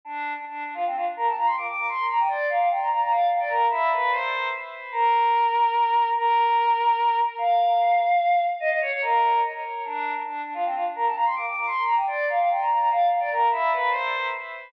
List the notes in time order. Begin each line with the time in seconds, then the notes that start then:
0.05 D4
0.36 D4
0.45 D4
0.64 D4
0.74 F4
0.86 C4
0.95 F4
1.16 A#4
1.26 A5
1.36 A#5
1.46 C6
1.57 D6
1.67 D6
1.77 D6
1.89 C6
2.09 A#5
2.19 G5
2.28 D5
2.49 F5
2.59 F5
2.69 G5
2.81 A#5
2.90 A#5
3.01 A#5
3.10 F5
3.29 F5
3.39 D5
3.48 A#4
3.70 E4
3.93 B4
4.11 C5
4.92 A#4
6.15 A#4
7.38 F5
8.60 D#5
8.69 D#5
8.81 C#5
8.92 C#5
9.01 A#4
9.85 D4
10.14 D4
10.23 D4
10.44 D4
10.54 F4
10.65 C4
10.74 F4
10.95 A#4
11.05 A5
11.14 A#5
11.25 C6
11.36 D6
11.46 D6
11.56 D6
11.66 C6
11.85 A#5
11.95 G5
12.07 D5
12.29 F5
12.39 F5
12.50 G5
12.60 A#5
12.69 A#5
12.78 A#5
12.90 F5
13.09 F5
13.20 D5
13.31 A#4
13.51 E4
13.71 B4
13.90 C5